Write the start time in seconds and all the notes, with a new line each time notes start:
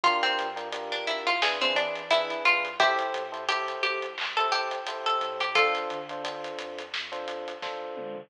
0.04 G1 D4 F4 G4 A#4, kick, closed hi-hat
0.23 C4, closed hi-hat
0.39 G2, closed hi-hat
0.56 D4 F4 G4 A#4, closed hi-hat
0.72 D4 F4 G4 A#4, closed hi-hat
0.92 D4, closed hi-hat
1.05 A#1 E4, closed hi-hat
1.27 F4, closed hi-hat
1.41 E2 D4 E4 G#4 B4, snare
1.61 C4 D4 E4 G#4 B4, closed hi-hat
1.75 E3 D4, closed hi-hat
1.96 snare, closed hi-hat
2.11 D4 E4 G#4 B4, closed hi-hat
2.30 closed hi-hat
2.45 G2 F4, closed hi-hat
2.65 closed hi-hat
2.79 A1 E4 G4 A4 C5, kick, closed hi-hat
2.99 closed hi-hat
3.14 A2, closed hi-hat
3.32 E4 G4 A4 C5, closed hi-hat
3.49 E4 G4 A4 C5, closed hi-hat
3.68 closed hi-hat
3.83 C2 G4, closed hi-hat
4.02 closed hi-hat
4.18 C2, clap
4.37 E4 G4 A4 C5, closed hi-hat
4.52 G4, closed hi-hat
4.71 closed hi-hat
4.87 A1 E4 G4 A4 C5, closed hi-hat
5.06 A4, closed hi-hat
5.21 A2, closed hi-hat
5.40 G4, closed hi-hat
5.55 D2 D4 F4 A4 C5, kick, closed hi-hat
5.75 closed hi-hat
5.90 D3, closed hi-hat
6.09 D4 F4 A4 C5, closed hi-hat
6.24 D4 F4 A4 C5, closed hi-hat
6.44 closed hi-hat
6.59 F2, closed hi-hat
6.79 closed hi-hat
6.94 F2, snare
7.12 D4 F4 A4 C5, closed hi-hat
7.28 closed hi-hat
7.48 closed hi-hat
7.62 D2 D4 F4 A4 C5, kick, snare
7.97 D3, mid tom
8.16 floor tom